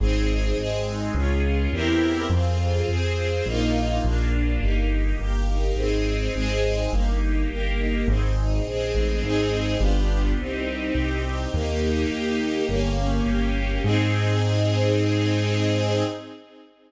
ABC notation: X:1
M:4/4
L:1/8
Q:1/4=104
K:Ab
V:1 name="String Ensemble 1"
C E A E D F [C=EGB]2 | C F A F [B,EF]2 B, =D | B, E G E C E A E | B, E G E C E A E |
[CEA]2 [=B,=DFG]2 C E G C | B, E G B, B, D G B, | [CEA]8 |]
V:2 name="Acoustic Grand Piano" clef=bass
A,,,2 A,,,2 D,,2 =E,,2 | F,,2 F,,2 B,,,2 B,,,2 | G,,,2 G,,,2 A,,,2 A,,,2 | G,,,2 G,,,2 A,,,2 B,,, =A,,, |
A,,,2 G,,,2 C,,2 C,,2 | E,,2 E,,2 G,,,2 G,,,2 | A,,8 |]
V:3 name="String Ensemble 1"
[CEA]2 [A,CA]2 [DFA]2 [C=EGB]2 | [CFA]2 [CAc]2 [B,EF]2 [B,=DF]2 | [B,EG]2 [B,GB]2 [CEA]2 [A,CA]2 | [B,EG]2 [B,GB]2 [CEA]2 [A,CA]2 |
[CEA]2 [=B,=DFG]2 [CEG]4 | [B,EG]4 [B,DG]4 | [CEA]8 |]